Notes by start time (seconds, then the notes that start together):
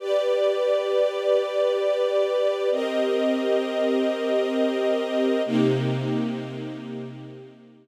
0.00 G4 B4 D5
2.72 C4 G4 A#4 D#5
5.45 C3 A#3 D#4 G4